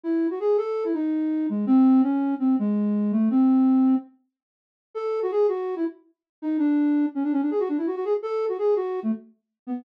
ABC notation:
X:1
M:9/8
L:1/16
Q:3/8=110
K:C#m
V:1 name="Flute"
E3 F G2 A3 E D6 G,2 | ^B,4 C4 B,2 G,6 A,2 | ^B,8 z10 | [K:F#m] A3 F G2 F3 E z6 _E2 |
D6 C D C D G F D E F F G z | A3 F G2 F3 A, z6 B,2 |]